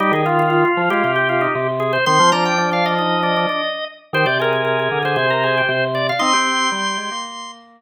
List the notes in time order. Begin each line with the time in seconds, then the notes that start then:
0.00 G3 D#4 G4
0.12 D#3 G#4
0.26 F4
0.39 F4
0.50 F4
0.65 F4
0.77 F3
0.90 G#3 F4 G4
1.04 C3 G4
1.16 G4
1.29 F4
1.41 D#4
1.55 C3
1.80 G#4
1.93 C5
2.06 D#3 C4 C6
2.20 F3
2.32 F3 D4 A#5
2.45 G5
2.58 D4
2.71 D4 F5
2.86 D#5
2.99 D#4
3.23 D4
3.36 D4
3.49 D4
4.13 D#3 G4 C5
4.26 C3 D5
4.40 G#4 A#4
4.53 A#4
4.65 G#4
4.79 G#4
4.91 D3
5.03 D3 G#4 C5
5.16 C3 C5
5.30 A#4
5.44 G#4
5.58 G4
5.69 C3
5.95 D5
6.09 F5
6.19 C4 D#4 C6
6.33 C4 G4
6.72 G3
6.98 G#3
7.11 A#3